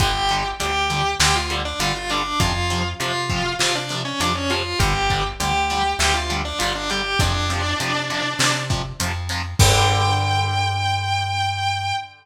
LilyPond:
<<
  \new Staff \with { instrumentName = "Distortion Guitar" } { \time 4/4 \key g \mixolydian \tempo 4 = 100 <g' g''>8. r16 <g' g''>4 <g' g''>16 <f' f''>16 r16 <d' d''>16 <f' f''>16 <f' f''>16 <d' d''>8 | <f' f''>8. r16 <f' f''>4 <f' f''>16 <d' d''>16 r16 <cis' cis''>16 <d' d''>16 <cis' cis''>16 <f' f''>8 | <g' g''>8. r16 <g' g''>4 <g' g''>16 <f' f''>16 r16 <d' d''>16 <f' f''>16 <d' d''>16 <g' g''>8 | <d' d''>2~ <d' d''>8 r4. |
g''1 | }
  \new Staff \with { instrumentName = "Overdriven Guitar" } { \clef bass \time 4/4 \key g \mixolydian <d g>8 <d g>8 <d g>8 <d g>8 <d g>8 <d g>8 <d g>8 <d g>8 | <c f>8 <c f>8 <c f>8 <c f>8 <c f>8 <c f>8 <c f>8 <c f>8 | <d g>8 <d g>8 <d g>8 <d g>8 <d g>8 <d g>8 <d g>8 <d g>8 | <c f>8 <c f>8 <c f>8 <c f>8 <c f>8 <c f>8 <c f>8 <c f>8 |
<d g>1 | }
  \new Staff \with { instrumentName = "Electric Bass (finger)" } { \clef bass \time 4/4 \key g \mixolydian g,,4 d,4 d,4 g,,4 | f,4 c4 c4 f,4 | g,,4 d,4 d,4 g,,4 | f,4 c4 c4 f,4 |
g,1 | }
  \new DrumStaff \with { instrumentName = "Drums" } \drummode { \time 4/4 <hh bd>8 hh8 hh8 hh8 sn8 hh8 hh8 hh8 | <hh bd>8 hh8 hh8 <hh bd>8 sn8 hh8 hh8 hh8 | <hh bd>8 <hh bd>8 hh8 hh8 sn8 hh8 hh8 hh8 | <hh bd>8 hh8 hh8 hh8 sn8 <hh bd>8 hh8 hho8 |
<cymc bd>4 r4 r4 r4 | }
>>